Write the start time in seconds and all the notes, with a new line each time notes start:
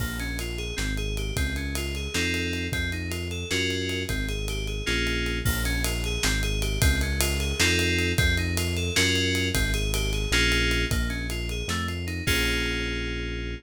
0.00 A#1 A#3, kick, crash
0.19 C#4, ride
0.39 F4, ride
0.58 G#4, ride
0.76 G#1 C4, snare
0.97 G#4, ride
1.17 G4, ride
1.36 C#2 C4, kick, ride
1.56 C#4, ride
1.75 F4, ride
1.95 G#4, ride
2.14 F2 C4 D#4 F4 A4, snare
2.34 ride
2.53 ride
2.72 F2 C4, kick, ride
2.92 D#4, ride
3.10 F4, ride
3.31 A4, ride
3.50 F#2 C#4 F4 F#4 A#4, snare
3.70 ride
3.89 ride
4.09 G#1 C4, kick, ride
4.28 G#4, ride
4.48 G4, ride
4.67 G#4, ride
4.86 A#1 A#3 C#4 F4 G#4, snare
5.07 ride
5.26 ride
5.45 A#1 A#3, kick, crash
5.65 C#4, ride
5.84 F4, ride
6.04 G#4, ride
6.23 G#1 C4, snare
6.43 G#4, ride
6.61 G4, ride
6.81 C#2 C4, kick, ride
7.01 C#4, ride
7.20 F4, ride
7.40 G#4, ride
7.59 F2 C4 D#4 F4 A4, snare
7.79 ride
7.99 ride
8.18 F2 C4, kick, ride
8.37 D#4, ride
8.57 F4, ride
8.76 A4, ride
8.96 F#2 C#4 F4 F#4 A#4, snare
9.16 ride
9.35 ride
9.54 G#1 C4, kick, ride
9.73 G#4, ride
9.94 G4, ride
10.13 G#4, ride
10.31 A#1 A#3 C#4 F4 G#4, snare
10.52 ride
10.71 ride
10.91 A#1 A#3, kick, ride
11.09 C#4, ride
11.30 F4, ride
11.49 G#4, ride
11.68 F2 A3, snare
11.88 F4, ride
12.07 D#4, ride
12.27 A#1 A#3 C#4 F4 G#4, kick, crash